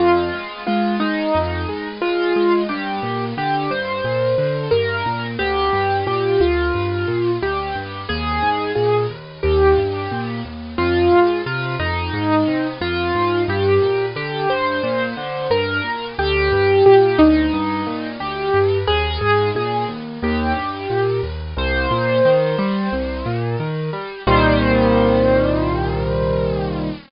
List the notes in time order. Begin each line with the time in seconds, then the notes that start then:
0.00 F2 F4
0.34 G#3
0.67 G#3 F4
1.00 G#3 D#4
1.35 F2
1.69 G#3
2.02 G#3 F4
2.36 G#3
2.69 G2 G4
3.03 A#2
3.37 D3 G4
3.70 G2 C5
4.04 A#2
4.38 D3
4.71 G2 A#4
5.06 A#2
5.39 D2 G4
5.73 G2
6.07 A#2 G4
6.40 D2 F4
6.74 G2
7.08 A#2
7.42 D2 G4
7.75 G2
8.09 D#2 G#4
8.42 G#2
8.75 A#2 G#4
9.10 D#2
9.43 D#2 G4
9.78 G2
10.11 A#2
10.45 D#2
10.78 F2 F4
11.12 G#2
11.46 C3 F4
11.79 F2 D#4
12.13 G#2
12.47 C3
12.81 F2 F4
13.15 G#2
13.48 G2 G4
13.82 A#2
14.16 D3 G4
14.49 G2 C5
14.83 A#2
15.17 D3
15.50 G2 A#4
15.84 A#2
16.19 D2 G4
16.52 G2
16.86 A#2 G4
17.19 D2 D#4
17.53 G2
17.87 A#2
18.20 D2 G4
18.54 G2
18.87 D#2 G#4
19.21 G#2
19.55 A#2 G#4
19.88 D#2
20.22 D#2 G4
20.56 G2
20.90 A#2
21.23 D#2
21.57 C2 C5
21.91 A#2
22.25 D#3
22.58 G3
22.92 C2
23.26 A#2
23.60 D#3
23.93 G3
24.27 C2 A#2 D#3 G3 C5